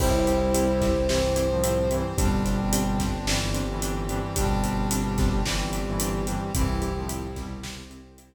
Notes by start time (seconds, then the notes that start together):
0.00 C2 G3 C4 E4 G4 C5, kick, crash
0.26 C4 E4 G4, closed hi-hat
0.54 C4 E4 G4, closed hi-hat
0.82 C4 E4 G4, kick, snare, closed hi-hat
1.09 G2 E3 C4 E4 G4 C5, snare
1.36 C4 E4 G4, closed hi-hat
1.50 A2 F3
1.63 C4 E4 G4, closed hi-hat
1.91 G2 E3 C4 E4 G4, closed hi-hat
2.17 G1 B2 G3 C4 D4 G4, kick, closed hi-hat
2.45 C4 D4 G4, closed hi-hat
2.72 C4 D4 G4, closed hi-hat
3.00 C4 D4 G4, kick, snare, closed hi-hat
3.27 G2 E3 G3 C4 D4 G4, snare
3.54 C4 D4 G4, closed hi-hat
3.69 G2 E3
3.82 C4 D4 G4, closed hi-hat
4.09 G2 E3 C4 D4 G4, closed hi-hat
4.35 G1 B2 G3 C4 D4 G4, kick, closed hi-hat
4.63 C4 D4 G4, closed hi-hat
4.91 C4 D4 G4, closed hi-hat
5.18 C4 D4 G4, kick, snare, closed hi-hat
5.45 G2 E3 G3 C4 D4 G4, snare
5.73 C4 D4 G4, closed hi-hat
5.87 G2 E3
6.00 C4 D4 G4, closed hi-hat
6.27 G2 E3 C4 D4 G4, closed hi-hat
6.54 C2 G2 E3 C4 E4 G4, kick, closed hi-hat
6.82 C4 E4 G4, closed hi-hat
6.96 A2 F3
7.08 C4 E4 G4, closed hi-hat
7.36 B2 G3 C4 E4 G4, kick, snare, closed hi-hat
7.63 C4 E4 G4 C5, snare
7.90 C4 E4 G4, closed hi-hat
8.18 C4 E4 G4, closed hi-hat